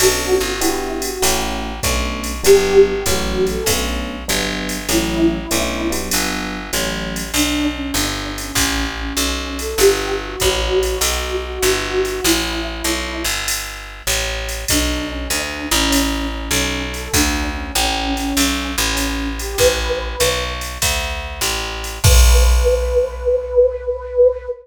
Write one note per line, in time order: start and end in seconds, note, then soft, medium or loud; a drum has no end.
0.00 0.38 B1 medium
0.00 0.52 B3 medium
0.00 0.52 C#4 medium
0.00 0.52 D4 medium
0.00 0.34 F#4 loud
0.00 0.52 A4 medium
0.00 crash medium
0.00 ride medium
0.40 1.18 G1 medium
0.40 0.59 F#4 loud
0.61 1.10 B3 medium
0.61 1.10 D4 loud
0.61 0.99 E4 loud
0.61 1.10 F#4 medium
0.61 1.10 G4 loud
0.61 hi-hat pedal medium
0.61 ride medium
1.02 1.22 F#4 loud
1.02 ride medium
1.22 1.80 A1 medium
1.22 1.71 A3 loud
1.22 1.71 C#4 loud
1.22 1.71 E4 medium
1.22 1.71 F#4 medium
1.22 ride medium
1.83 2.42 B1 medium
1.83 2.32 A3 loud
1.83 2.32 B3 medium
1.83 2.32 C#4 medium
1.83 2.32 D4 medium
1.83 kick medium
1.83 hi-hat pedal medium
1.83 ride medium
2.24 ride medium
2.43 3.04 G1 medium
2.43 2.93 F#3 medium
2.43 2.93 G3 medium
2.43 2.93 B3 medium
2.43 2.93 D4 medium
2.43 2.80 G4 loud
2.43 ride medium
2.87 3.03 G4 loud
3.06 3.64 A1 medium
3.06 3.56 E3 medium
3.06 3.56 F#3 medium
3.06 3.56 A3 medium
3.06 3.56 C#4 medium
3.06 3.45 F#4 loud
3.06 kick soft
3.06 hi-hat pedal medium
3.06 ride medium
3.47 3.66 A4 loud
3.47 ride medium
3.66 4.24 B1 medium
3.66 4.16 A3 medium
3.66 4.16 B3 loud
3.66 4.16 C#4 medium
3.66 4.16 D4 medium
3.66 kick soft
3.66 ride medium
4.28 4.87 G1 medium
4.28 4.78 F#3 medium
4.28 4.78 G3 medium
4.28 4.78 B3 medium
4.28 4.78 D4 loud
4.28 hi-hat pedal medium
4.28 ride medium
4.69 ride medium
4.89 5.47 A1 medium
4.89 5.38 E3 loud
4.89 5.38 F#3 medium
4.89 5.38 A3 medium
4.89 5.38 C#4 medium
4.89 6.00 E4 loud
4.89 ride medium
5.51 6.10 B1 medium
5.51 5.90 A3 medium
5.51 5.90 B3 medium
5.51 5.90 C#4 medium
5.51 5.90 D4 medium
5.51 hi-hat pedal medium
5.51 ride medium
5.90 6.59 F#3 medium
5.90 6.59 G3 medium
5.90 6.59 B3 medium
5.90 6.59 D4 medium
5.90 ride medium
6.11 6.71 G1 medium
6.11 ride medium
6.73 7.32 A1 medium
6.73 7.22 E3 medium
6.73 7.22 F#3 medium
6.73 7.22 A3 medium
6.73 7.22 C#4 medium
6.73 hi-hat pedal medium
6.73 ride medium
7.16 ride medium
7.33 7.92 B1 medium
7.33 7.67 D4 loud
7.33 ride medium
7.75 7.94 C#4 medium
7.94 8.52 G1 medium
7.94 8.32 D4 medium
7.94 hi-hat pedal medium
7.94 ride medium
8.38 8.84 C#4 medium
8.38 ride medium
8.55 9.13 A1 medium
8.55 kick soft
8.55 ride medium
9.00 9.59 C#4 medium
9.17 9.75 B1 medium
9.17 hi-hat pedal medium
9.17 ride medium
9.59 9.78 A4 medium
9.59 ride medium
9.78 10.36 G1 medium
9.78 10.13 G4 medium
9.78 ride medium
10.23 10.40 F#4 medium
10.40 10.99 A1 medium
10.40 10.82 F#4 loud
10.40 kick soft
10.40 hi-hat pedal medium
10.40 ride medium
10.82 11.36 F#4 medium
10.82 ride medium
11.01 11.59 B1 medium
11.01 ride medium
11.44 12.03 F#4 medium
11.63 12.21 G1 medium
11.63 hi-hat pedal medium
11.63 ride medium
12.05 12.25 F#4 medium
12.05 ride medium
12.24 12.82 A1 medium
12.24 13.22 E4 loud
12.24 ride medium
12.84 13.24 B1 medium
12.84 hi-hat pedal medium
12.84 ride medium
13.24 14.02 G1 medium
13.24 ride medium
13.48 ride medium
14.07 14.65 A1 medium
14.07 hi-hat pedal medium
14.07 ride medium
14.49 ride medium
14.68 15.28 B1 medium
14.68 15.10 D4 loud
14.68 kick soft
14.68 ride medium
15.10 15.27 C#4 loud
15.30 15.69 D2 medium
15.30 15.66 D4 loud
15.30 hi-hat pedal medium
15.30 ride medium
15.71 16.49 A1 loud
15.71 16.26 C#4 medium
15.71 ride medium
15.92 ride medium
16.32 16.82 C#4 medium
16.51 17.09 B1 medium
16.51 hi-hat pedal medium
16.51 ride medium
16.94 17.12 A4 medium
16.94 ride medium
17.13 17.72 D2 medium
17.13 17.49 D4 loud
17.13 kick medium
17.13 ride medium
17.55 17.73 C#4 medium
17.75 18.33 A1 loud
17.75 18.13 C#4 medium
17.75 hi-hat pedal medium
17.75 ride medium
18.17 18.71 C#4 loud
18.17 ride medium
18.37 18.76 B1 medium
18.37 ride medium
18.78 19.56 A1 loud
18.78 19.28 C#4 loud
18.97 hi-hat pedal medium
18.97 ride medium
19.39 19.56 G4 loud
19.39 ride medium
19.58 20.16 A1 medium
19.58 20.43 B4 loud
19.58 kick soft
19.58 ride medium
20.20 20.78 B1 medium
20.20 hi-hat pedal medium
20.20 ride medium
20.61 ride medium
20.82 21.40 D2 medium
20.82 kick soft
20.82 ride medium
21.41 21.99 A1 medium
21.41 hi-hat pedal medium
21.41 ride medium
21.84 ride medium
22.04 24.48 B1 loud
22.04 24.49 B4 loud
22.04 kick loud
22.04 crash loud